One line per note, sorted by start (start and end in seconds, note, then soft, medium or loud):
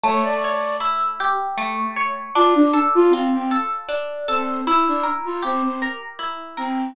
0.04 1.57 A3 medium
0.04 0.23 C#5 medium
0.24 0.77 D5 medium
0.44 1.96 C#5 medium
0.80 2.26 E4 medium
1.20 2.30 G4 medium
1.58 2.31 A3 medium
1.96 2.33 C#5 medium
2.35 3.88 D4 medium
2.35 2.54 F4 medium
2.55 2.74 D4 medium
2.73 3.51 A4 medium
2.95 3.13 F4 medium
3.10 3.29 C4 medium
3.10 4.59 F4 medium
3.33 3.51 C4 medium
3.51 4.28 A4 medium
3.89 4.62 D4 medium
4.28 4.61 C4 medium
4.28 4.65 A4 medium
4.67 4.85 E4 medium
4.67 6.19 E4 medium
4.88 5.06 D4 medium
5.03 5.81 A#4 medium
5.25 5.43 F4 medium
5.42 5.62 C4 medium
5.42 6.89 G4 medium
5.63 5.81 C4 medium
5.82 6.57 A#4 medium
6.19 6.92 E4 medium
6.57 6.92 C4 medium
6.57 6.94 A#4 medium